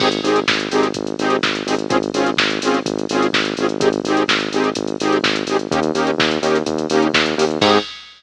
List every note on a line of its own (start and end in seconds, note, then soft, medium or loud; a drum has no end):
0.00 0.20 G#1 medium
0.00 0.09 C4 loud
0.00 0.09 D#4 medium
0.00 0.09 G4 loud
0.00 0.09 G#4 loud
0.00 kick medium
0.00 crash loud
0.12 closed hi-hat medium
0.23 0.44 G#1 medium
0.23 0.40 C4 medium
0.23 0.40 D#4 medium
0.23 0.40 G4 medium
0.23 0.40 G#4 medium
0.23 open hi-hat medium
0.36 closed hi-hat medium
0.48 0.68 G#1 medium
0.48 kick medium
0.48 snare loud
0.60 closed hi-hat medium
0.71 0.92 G#1 medium
0.71 0.87 C4 medium
0.71 0.87 D#4 loud
0.71 0.87 G4 medium
0.71 0.87 G#4 medium
0.71 open hi-hat medium
0.83 closed hi-hat medium
0.94 1.15 G#1 medium
0.94 kick medium
0.94 closed hi-hat loud
1.07 closed hi-hat medium
1.19 1.39 G#1 medium
1.19 1.37 C4 medium
1.19 1.37 D#4 loud
1.19 1.37 G4 medium
1.19 1.37 G#4 medium
1.19 open hi-hat medium
1.30 closed hi-hat medium
1.43 1.63 G#1 medium
1.43 kick medium
1.43 snare loud
1.55 closed hi-hat medium
1.67 1.87 G#1 medium
1.67 1.75 C4 medium
1.67 1.75 D#4 medium
1.67 1.75 G4 medium
1.67 1.75 G#4 medium
1.67 open hi-hat medium
1.79 closed hi-hat medium
1.89 2.10 G#1 medium
1.89 1.97 C4 loud
1.89 1.97 C#4 loud
1.89 1.97 F4 medium
1.89 1.97 G#4 loud
1.89 kick loud
1.89 closed hi-hat loud
2.03 closed hi-hat medium
2.14 2.34 G#1 medium
2.14 2.30 C4 medium
2.14 2.30 C#4 medium
2.14 2.30 F4 medium
2.14 2.30 G#4 medium
2.14 open hi-hat medium
2.26 closed hi-hat medium
2.37 2.59 G#1 medium
2.37 kick medium
2.37 snare loud
2.50 closed hi-hat medium
2.62 2.82 G#1 medium
2.62 2.79 C4 medium
2.62 2.79 C#4 medium
2.62 2.79 F4 medium
2.62 2.79 G#4 medium
2.62 open hi-hat medium
2.74 closed hi-hat medium
2.86 3.06 G#1 medium
2.86 kick medium
2.86 closed hi-hat loud
2.99 closed hi-hat medium
3.09 3.30 G#1 medium
3.09 3.27 C4 medium
3.09 3.27 C#4 medium
3.09 3.27 F4 medium
3.09 3.27 G#4 medium
3.09 open hi-hat medium
3.22 closed hi-hat medium
3.33 3.54 G#1 medium
3.33 kick medium
3.33 snare loud
3.45 closed hi-hat medium
3.57 3.78 G#1 medium
3.57 3.67 C4 medium
3.57 3.67 C#4 medium
3.57 3.67 F4 medium
3.57 3.67 G#4 medium
3.57 open hi-hat medium
3.69 closed hi-hat medium
3.80 4.00 G#1 medium
3.80 3.89 C4 medium
3.80 3.89 D#4 medium
3.80 3.89 G4 medium
3.80 3.89 G#4 medium
3.80 kick loud
3.80 closed hi-hat loud
3.93 closed hi-hat medium
4.04 4.25 G#1 medium
4.04 4.23 C4 medium
4.04 4.23 D#4 medium
4.04 4.23 G4 medium
4.04 4.23 G#4 medium
4.04 open hi-hat medium
4.17 closed hi-hat medium
4.28 4.49 G#1 medium
4.28 kick medium
4.28 snare loud
4.40 closed hi-hat medium
4.52 4.73 G#1 medium
4.52 4.70 C4 medium
4.52 4.70 D#4 medium
4.52 4.70 G4 medium
4.52 4.70 G#4 medium
4.52 open hi-hat medium
4.64 closed hi-hat medium
4.75 4.96 G#1 medium
4.75 kick medium
4.75 closed hi-hat loud
4.87 closed hi-hat medium
5.00 5.20 G#1 medium
5.00 5.18 C4 medium
5.00 5.18 D#4 medium
5.00 5.18 G4 medium
5.00 5.18 G#4 medium
5.00 open hi-hat medium
5.12 closed hi-hat medium
5.23 5.44 G#1 medium
5.23 kick medium
5.23 snare loud
5.36 closed hi-hat medium
5.47 5.67 G#1 medium
5.47 5.57 C4 medium
5.47 5.57 D#4 medium
5.47 5.57 G4 medium
5.47 5.57 G#4 medium
5.47 open hi-hat medium
5.59 closed hi-hat medium
5.71 5.92 D#2 medium
5.71 5.80 A#3 medium
5.71 5.80 C#4 medium
5.71 5.80 D#4 medium
5.71 5.80 G4 loud
5.71 kick loud
5.71 closed hi-hat loud
5.83 closed hi-hat medium
5.94 6.15 D#2 medium
5.94 6.11 A#3 medium
5.94 6.11 C#4 medium
5.94 6.11 D#4 medium
5.94 6.11 G4 medium
5.94 open hi-hat medium
6.07 closed hi-hat medium
6.18 6.38 D#2 medium
6.18 kick loud
6.18 snare loud
6.31 closed hi-hat medium
6.41 6.63 D#2 medium
6.41 6.58 A#3 medium
6.41 6.58 C#4 medium
6.41 6.58 D#4 medium
6.41 6.58 G4 medium
6.41 open hi-hat medium
6.55 closed hi-hat medium
6.66 6.87 D#2 medium
6.66 kick medium
6.66 closed hi-hat loud
6.78 closed hi-hat medium
6.90 7.11 D#2 medium
6.90 7.07 A#3 medium
6.90 7.07 C#4 medium
6.90 7.07 D#4 medium
6.90 7.07 G4 medium
6.90 open hi-hat medium
7.02 closed hi-hat medium
7.14 7.35 D#2 medium
7.14 kick medium
7.14 snare loud
7.26 closed hi-hat medium
7.37 7.58 D#2 medium
7.37 7.45 A#3 medium
7.37 7.45 C#4 medium
7.37 7.45 D#4 medium
7.37 7.45 G4 medium
7.37 open hi-hat medium
7.50 closed hi-hat medium
7.61 7.78 G#2 loud
7.61 7.78 C4 loud
7.61 7.78 D#4 medium
7.61 7.78 G4 loud
7.61 7.78 G#4 loud
7.61 kick loud
7.61 crash loud